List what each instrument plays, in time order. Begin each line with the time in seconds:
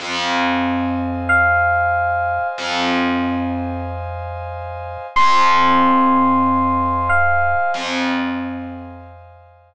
0.00 electric bass (finger) F2, pad 2 (warm) C5 D#5 F5 G#5
1.29 electric piano 1 F5
2.58 electric bass (finger) F2
5.16 electric bass (finger) F2, pad 2 (warm) C5 D#5 F5 G#5, electric piano 1 C6
7.09 electric piano 1 F5
7.74 electric bass (finger) F2